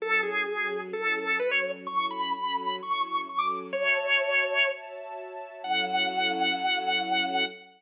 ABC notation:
X:1
M:4/4
L:1/16
Q:1/4=128
K:F#m
V:1 name="Drawbar Organ"
A2 G6 A4 B c2 z | c'2 b6 c'4 c' d'2 z | c10 z6 | f16 |]
V:2 name="String Ensemble 1"
[F,CEA]4 [F,CFA]4 [F,CEA]4 [F,CFA]4 | [F,CEA]4 [F,CFA]4 [F,CEA]4 [F,CFA]4 | [Fcea]8 [Fcea]8 | [F,CEA]16 |]